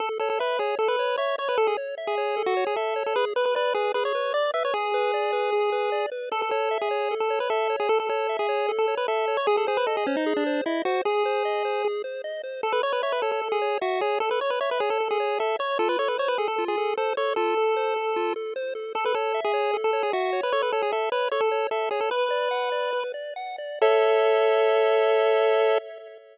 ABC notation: X:1
M:4/4
L:1/16
Q:1/4=152
K:A
V:1 name="Lead 1 (square)"
A z A A B2 G2 A B3 c2 c B | A G z3 G4 F2 G A3 A | B z B B B2 G2 B c3 d2 e c | G14 z2 |
A A A3 G4 A2 B A3 G | A A A3 G4 A2 B A3 c | G A G B A G C ^D2 =D3 E2 F2 | G10 z6 |
A B c B c B A A2 G3 F2 G2 | A B c B c B G A2 G3 A2 c2 | A B c B c B G A2 G3 A2 c2 | A12 z4 |
A B A3 G4 A2 G F3 B | c B A G A2 B2 c A3 A2 G A | "^rit." B10 z6 | A16 |]
V:2 name="Lead 1 (square)"
A2 c2 e2 c2 A2 c2 e2 c2 | A2 c2 e2 c2 A2 c2 e2 c2 | G2 B2 d2 B2 G2 B2 d2 B2 | G2 B2 d2 B2 G2 B2 d2 B2 |
A2 c2 e2 c2 A2 c2 e2 c2 | A2 c2 e2 c2 A2 c2 e2 c2 | G2 ^B2 ^d2 B2 G2 B2 d2 B2 | G2 ^B2 ^d2 B2 G2 B2 d2 B2 |
A2 c2 e2 c2 A2 c2 e2 c2 | A2 c2 e2 c2 A2 c2 e2 c2 | =F2 A2 =c2 A2 F2 A2 c2 A2 | =F2 A2 =c2 A2 F2 A2 c2 A2 |
A2 c2 e2 c2 A2 c2 e2 c2 | A2 c2 e2 c2 A2 c2 e2 c2 | "^rit." B2 d2 f2 d2 B2 d2 f2 d2 | [Ace]16 |]